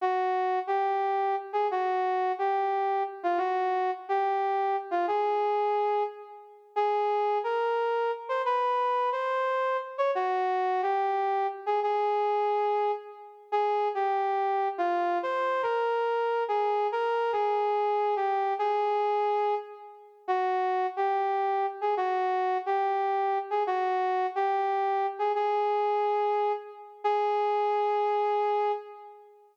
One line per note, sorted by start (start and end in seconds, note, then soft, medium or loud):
0.01 0.59 F#4 medium
0.67 1.36 G4 medium
1.53 1.67 G#4 medium
1.71 2.32 F#4 medium
2.39 3.03 G4 medium
3.23 3.39 F4 medium
3.38 3.91 F#4 medium
4.09 4.76 G4 medium
4.91 5.06 F4 medium
5.08 6.03 G#4 medium
6.76 7.38 G#4 medium
7.44 8.11 A#4 medium
8.29 8.42 C5 medium
8.46 9.10 B4 medium
9.12 9.77 C5 medium
9.98 10.11 C#5 medium
10.15 10.81 F#4 medium
10.82 11.47 G4 medium
11.66 11.80 G#4 medium
11.83 12.92 G#4 medium
13.52 13.88 G#4 medium
13.95 14.68 G4 medium
14.78 15.18 F4 medium
15.23 15.62 C5 medium
15.62 16.44 A#4 medium
16.48 16.87 G#4 medium
16.92 17.32 A#4 medium
17.32 18.15 G#4 medium
18.16 18.54 G4 medium
18.59 19.55 G#4 medium
20.28 20.87 F#4 medium
20.97 21.66 G4 medium
21.81 21.95 G#4 medium
21.97 22.58 F#4 medium
22.66 23.38 G4 medium
23.50 23.63 G#4 medium
23.67 24.26 F#4 medium
24.36 25.07 G4 medium
25.19 25.32 G#4 medium
25.35 26.52 G#4 medium
27.04 28.72 G#4 loud